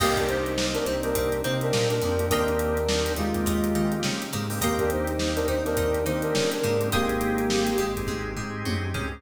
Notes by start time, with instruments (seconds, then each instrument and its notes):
0.00 synth bass 1 C2, drawbar organ A#3 C4 D#4 G4, brass section A#3 G4, acoustic guitar (steel) D#5 G5 A#5 C6, kick, crash
0.17 brass section D4 A#4, kick, closed hi-hat
0.28 brass section D#4 C5, closed hi-hat
0.46 closed hi-hat
0.58 drawbar organ A#3 C4 D#4 G4, snare
0.74 brass section D4 A#4, closed hi-hat
0.85 synth bass 1 C2, acoustic guitar (steel) C4, brass section D#4 C5, snare, closed hi-hat
1.03 drawbar organ A#3 C4 D#4 G4, brass section D4 A#4, closed hi-hat
1.15 synth bass 1 C2, acoustic guitar (steel) C4, kick, closed hi-hat
1.32 closed hi-hat
1.44 synth bass 1 C3, drawbar organ A#3 C4 D#4 G4, acoustic guitar (steel) C4, brass section D#4 C5, closed hi-hat
1.61 brass section D4 A#4, closed hi-hat
1.73 synth bass 1 A#2, acoustic guitar (steel) A#3, snare
1.90 brass section D4 A#4, closed hi-hat
2.02 synth bass 1 F2, acoustic guitar (steel) F3, drawbar organ A#3 C4 D#4 G4, closed hi-hat
2.19 drawbar organ A#3 C4 D#4 G4, closed hi-hat
2.30 synth bass 1 D#2, drawbar organ A#3 C4 D#4 G4, brass section D4 A#4, acoustic guitar (steel) D#5 G5 A#5 C6, kick, closed hi-hat
2.48 closed hi-hat
2.59 closed hi-hat
2.77 closed hi-hat
2.88 drawbar organ A#3 C4 D#4 G4, snare
3.06 closed hi-hat
3.16 synth bass 1 D#2, brass section G#3 F4, acoustic guitar (steel) D#4, closed hi-hat
3.34 drawbar organ A#3 C4 D#4 G4, kick, closed hi-hat
3.46 synth bass 1 D#2, acoustic guitar (steel) D#4, kick, closed hi-hat
3.64 closed hi-hat
3.75 synth bass 1 D#3, drawbar organ A#3 C4 D#4 G4, acoustic guitar (steel) D#4, closed hi-hat
3.92 closed hi-hat
4.03 synth bass 1 C#3, acoustic guitar (steel) C#4, snare
4.22 closed hi-hat
4.33 synth bass 1 G#2, acoustic guitar (steel) G#3, drawbar organ A#3 C4 D#4 G4, closed hi-hat
4.50 drawbar organ A#3 C4 D#4 G4, snare, open hi-hat
4.61 synth bass 1 D#2, drawbar organ A#3 C4 D#4 G4, brass section A#3 G4, acoustic guitar (steel) D#5 G5 A#5 C6, kick, closed hi-hat
4.79 brass section D4 A#4, kick, closed hi-hat
4.90 brass section D#4 C5, closed hi-hat
5.07 closed hi-hat
5.19 drawbar organ A#3 C4 D#4 G4, snare
5.36 brass section D4 A#4, closed hi-hat
5.48 synth bass 1 D#2, brass section D#4 C5, acoustic guitar (steel) D#4, closed hi-hat
5.65 drawbar organ A#3 C4 D#4 G4, brass section D4 A#4, snare, closed hi-hat
5.77 synth bass 1 D#2, acoustic guitar (steel) D#4, kick, closed hi-hat
5.94 closed hi-hat
6.06 synth bass 1 D#3, drawbar organ A#3 C4 D#4 G4, brass section D#4 C5, acoustic guitar (steel) D#4, closed hi-hat
6.22 brass section D4 A#4, closed hi-hat
6.35 synth bass 1 C#3, acoustic guitar (steel) C#4, snare
6.52 brass section D4 A#4, closed hi-hat
6.63 synth bass 1 G#2, acoustic guitar (steel) G#3, drawbar organ A#3 C4 D#4 G4, closed hi-hat
6.81 drawbar organ A#3 C4 D#4 G4, closed hi-hat
6.92 synth bass 1 G#1, brass section A#3 G4, drawbar organ C4 D#4 G4 G#4, acoustic guitar (steel) D#5 G5 G#5 C6, kick, closed hi-hat
7.09 closed hi-hat
7.21 closed hi-hat
7.38 closed hi-hat
7.50 drawbar organ C4 D#4 G4 G#4, snare
7.67 closed hi-hat
7.78 synth bass 1 G#1, acoustic guitar (steel) G#3, closed hi-hat
7.96 drawbar organ C4 D#4 G4 G#4, kick, closed hi-hat
8.07 synth bass 1 G#1, acoustic guitar (steel) G#3, kick, high tom
8.36 synth bass 1 G#2, acoustic guitar (steel) G#3, drawbar organ C4 D#4 G4 G#4, floor tom
8.65 synth bass 1 F#2, acoustic guitar (steel) F#3, high tom
8.94 synth bass 1 C#2, drawbar organ C4 D#4 G4 G#4, acoustic guitar (steel) C#4, floor tom
9.12 drawbar organ C4 D#4 G4 G#4